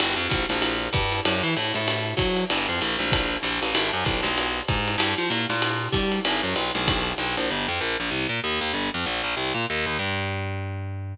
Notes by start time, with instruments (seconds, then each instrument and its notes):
0.00 electric bass (finger) G1, ride
0.16 electric bass (finger) F2
0.29 electric bass (finger) A#1, kick, hi-hat pedal, ride
0.49 electric bass (finger) A#1, snare, ride
0.62 ride
0.93 electric bass (finger) G2, kick, hi-hat pedal, ride
1.12 ride
1.25 electric bass (finger) F#2, ride
1.43 electric bass (finger) E3
1.57 electric bass (finger) A2, hi-hat pedal, ride
1.74 electric bass (finger) A2, snare, ride
1.88 ride
2.17 electric bass (finger) F#3, kick, hi-hat pedal, ride
2.36 ride
2.50 electric bass (finger) G1, ride
2.69 electric bass (finger) F2
2.81 electric bass (finger) A#1, hi-hat pedal, ride
2.99 electric bass (finger) A#1, snare, ride
3.12 kick, ride
3.43 electric bass (finger) A#1, hi-hat pedal, ride
3.62 electric bass (finger) A1, ride
3.75 electric bass (finger) G#1, ride
3.93 electric bass (finger) F#2
4.05 electric bass (finger) B1, kick, hi-hat pedal, ride
4.23 electric bass (finger) B1, snare, ride
4.38 ride
4.68 electric bass (finger) G#2, kick, hi-hat pedal, ride
4.88 ride
4.98 electric bass (finger) G2, ride
5.18 electric bass (finger) F3
5.30 electric bass (finger) A#2, hi-hat pedal, ride
5.50 electric bass (finger) A#2, snare, ride
5.62 ride
5.92 electric bass (finger) G3, kick, hi-hat pedal, ride
6.12 ride
6.25 electric bass (finger) G#1, ride
6.43 electric bass (finger) F#2
6.55 electric bass (finger) B1, hi-hat pedal, ride
6.75 electric bass (finger) B1, snare, ride
6.88 kick, ride
7.18 electric bass (finger) B1, hi-hat pedal, ride
7.37 electric bass (finger) A#1, ride
7.51 electric bass (finger) G1
7.68 electric bass (finger) F2
7.81 electric bass (finger) A#1
8.00 electric bass (finger) A#1
8.11 electric bass (finger) C2
8.29 electric bass (finger) A#2
8.44 electric bass (finger) D#2
8.61 electric bass (finger) D#2
8.74 electric bass (finger) G1
8.94 electric bass (finger) F2
9.06 electric bass (finger) A#1
9.24 electric bass (finger) A#1
9.37 electric bass (finger) C2
9.54 electric bass (finger) A#2
9.70 electric bass (finger) D#2
9.86 electric bass (finger) D#2
9.99 electric bass (finger) G2